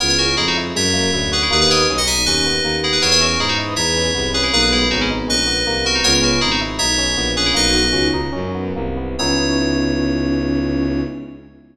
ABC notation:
X:1
M:4/4
L:1/16
Q:1/4=159
K:C#dor
V:1 name="Electric Piano 2"
[Ac] [Ac] [FA]2 [EG] [DF] z2 [ce]6 [GB] [EG] | [GB] [GB] [Ac]2 z [df] [eg]2 [Bd]6 [EG] [GB] | [Ac] [Ac] [FA]2 [EG] [DF] z2 [ce]6 [GB] [EG] | [GB] [GB] [EG]2 [DF] [CE] z2 [Bd]6 [FA] [DF] |
[Ac] [Ac] [FA]2 [EG] [DF] z2 [ce]6 [GB] [EG] | "^rit." [Bd]6 z10 | c16 |]
V:2 name="Choir Aahs"
[EG]6 z10 | [Bd]6 z10 | [ce]3 z3 [Bd]2 [GB]8 | [G,B,]4 [G,B,]6 z6 |
[G,B,]4 z12 | "^rit." [DF]8 z8 | C16 |]
V:3 name="Electric Piano 1"
B,2 C2 D2 E2 G,2 A,2 E2 F2 | A,2 B,2 C2 D2 C2 B,2 A,2 B,2 | B,2 C2 D2 E2 D2 C2 B,2 C2 | A,2 B,2 C2 D2 C2 B,2 A,2 B,2 |
B,2 C2 D2 E2 D2 C2 B,2 C2 | "^rit." A,2 B,2 C2 D2 C2 B,2 A,2 B,2 | [B,CDE]16 |]
V:4 name="Violin" clef=bass
C,,4 =F,,4 ^F,,4 =D,,4 | D,,4 B,,,4 D,,4 D,,4 | E,,4 G,,4 E,,4 ^B,,,4 | B,,,4 G,,,4 A,,,4 ^B,,,4 |
C,,4 G,,,4 B,,,4 A,,,4 | "^rit." B,,,4 C,,4 F,,4 ^B,,,4 | C,,16 |]